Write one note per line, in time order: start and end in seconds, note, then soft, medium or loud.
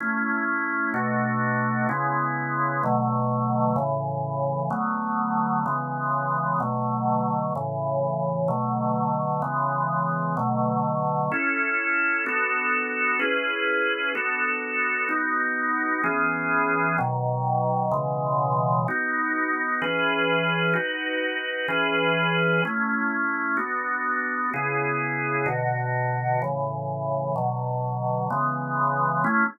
0.00 0.93 A3 medium
0.00 0.94 C#4 medium
0.00 0.94 E4 medium
0.94 1.87 B2 medium
0.94 1.87 A3 medium
0.94 1.87 D4 medium
0.94 1.87 F#4 medium
1.89 2.82 C#3 medium
1.89 2.82 G#3 medium
1.89 2.82 B3 medium
1.89 2.82 E4 medium
2.83 3.77 B2 medium
2.83 3.77 D3 medium
2.83 3.77 F#3 medium
2.83 3.77 A3 medium
3.76 4.69 A2 medium
3.76 4.69 C#3 medium
3.76 4.69 E3 medium
4.70 5.64 D3 medium
4.70 5.64 F#3 medium
4.70 5.64 A3 medium
4.70 5.64 B3 medium
5.66 6.59 C#3 medium
5.66 6.59 E3 medium
5.66 6.59 G#3 medium
5.66 6.59 B3 medium
6.60 7.54 B2 medium
6.60 7.54 D3 medium
6.60 7.54 F#3 medium
6.60 7.54 A3 medium
7.55 8.49 A2 medium
7.55 8.49 C#3 medium
7.55 8.49 E3 medium
8.48 9.42 B2 medium
8.48 9.42 D3 medium
8.48 9.42 F#3 medium
8.48 9.42 A3 medium
9.42 10.35 C#3 medium
9.42 10.35 E3 medium
9.42 10.35 G#3 medium
9.42 10.35 B3 medium
10.37 11.30 B2 medium
10.37 11.30 D3 medium
10.37 11.30 F#3 medium
10.37 11.30 A3 medium
11.32 12.25 C#4 medium
11.32 12.25 E4 medium
11.32 12.25 A4 medium
12.26 13.20 B3 medium
12.26 13.20 D4 medium
12.26 13.20 F#4 medium
12.26 13.20 A4 medium
13.19 14.13 C#4 medium
13.19 14.13 E4 medium
13.19 14.13 G#4 medium
13.19 14.13 B4 medium
14.15 15.08 B3 medium
14.15 15.08 D4 medium
14.15 15.08 F#4 medium
14.15 15.08 A4 medium
15.09 16.02 B3 medium
15.09 16.02 D#4 medium
15.09 16.02 F#4 medium
16.04 16.97 E3 medium
16.04 16.97 B3 medium
16.04 16.97 C#4 medium
16.04 16.97 G#4 medium
16.98 17.91 B2 medium
16.98 17.92 D#3 medium
16.98 17.92 F#3 medium
17.92 18.85 B2 medium
17.92 18.85 C#3 medium
17.92 18.85 E3 medium
17.92 18.85 G#3 medium
18.88 19.82 B3 medium
18.88 19.82 D#4 medium
18.88 19.82 F#4 medium
19.82 20.75 E3 medium
19.82 20.75 C#4 medium
19.82 20.75 G#4 medium
19.82 20.73 B4 medium
20.74 21.67 D#4 medium
20.74 21.67 F#4 medium
20.74 21.67 B4 medium
21.68 22.62 E3 medium
21.68 22.62 C#4 medium
21.68 22.62 G#4 medium
21.68 22.62 B4 medium
22.65 23.58 A3 medium
22.65 23.58 C#4 medium
22.65 23.58 E4 medium
23.57 24.50 B3 medium
23.57 24.50 D4 medium
23.57 24.50 F#4 medium
24.54 25.47 C#3 medium
24.54 25.47 B3 medium
24.54 25.47 E4 medium
24.54 25.47 G#4 medium
25.46 26.39 B2 medium
25.46 26.39 D3 medium
25.46 26.39 F#4 medium
26.42 27.35 A2 medium
26.42 27.35 C#3 medium
26.42 27.35 E3 medium
27.36 28.29 B2 medium
27.36 28.29 D3 medium
27.36 28.29 F#3 medium
28.30 29.24 C#3 medium
28.30 29.24 E3 medium
28.30 29.24 G#3 medium
28.30 29.24 B3 medium
29.24 29.44 A3 loud
29.24 29.44 C#4 loud
29.24 29.44 E4 loud